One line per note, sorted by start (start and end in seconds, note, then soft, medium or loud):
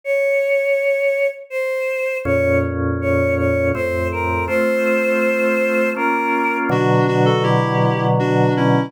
0.04 1.27 C#5 loud
1.50 2.17 C5 medium
2.25 3.72 F2 medium
2.25 3.72 A#2 medium
2.25 3.72 C#4 medium
2.25 2.58 C#5 medium
3.01 3.35 C#5 medium
3.38 3.69 C#5 medium
3.74 4.48 F2 medium
3.74 4.48 A2 medium
3.74 4.47 C4 medium
3.74 4.08 C5 medium
4.12 4.45 A#4 medium
4.47 5.94 A3 medium
4.47 5.94 C4 medium
4.47 5.94 F4 medium
4.47 5.90 C5 loud
5.96 6.70 A#3 medium
5.96 6.70 C#4 medium
5.96 6.70 F4 medium
5.96 6.57 A#4 medium
6.69 8.89 B2 loud
6.69 8.89 D3 medium
6.69 8.89 F#3 medium
6.69 7.06 D4 loud
6.69 7.06 F#4 loud
7.08 7.26 D4 loud
7.08 7.25 F#4 loud
7.25 7.43 F#4 medium
7.25 7.43 A4 loud
7.43 8.05 E4 medium
7.43 8.05 G4 loud
8.19 8.54 D4 medium
8.19 8.54 F#4 loud
8.57 8.92 C#4 medium
8.57 8.92 E4 loud